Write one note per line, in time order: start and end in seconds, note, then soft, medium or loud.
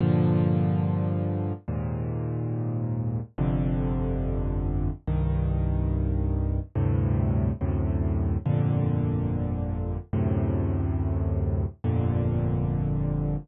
0.01 1.53 G2 medium
0.01 1.53 A#2 medium
0.01 1.53 D3 medium
0.01 1.53 F3 medium
1.68 3.20 D#2 medium
1.68 3.20 G#2 medium
1.68 3.20 A#2 medium
3.38 4.90 G1 medium
3.38 4.90 F2 medium
3.38 4.90 C3 medium
3.38 4.90 D3 medium
5.07 6.60 C2 medium
5.07 6.60 G2 medium
5.07 6.60 D#3 medium
6.75 7.51 D2 medium
6.75 7.51 G2 medium
6.75 7.51 A2 medium
6.75 7.51 C3 medium
7.61 8.37 D2 medium
7.61 8.37 F#2 medium
7.61 8.37 A2 medium
7.61 8.37 C3 medium
8.46 9.98 G1 medium
8.46 9.98 F2 medium
8.46 9.98 A#2 medium
8.46 9.98 D3 medium
10.13 11.65 D2 medium
10.13 11.65 F#2 medium
10.13 11.65 A2 medium
10.13 11.65 C3 medium
11.84 13.36 G1 medium
11.84 13.36 F2 medium
11.84 13.36 A#2 medium
11.84 13.36 D3 medium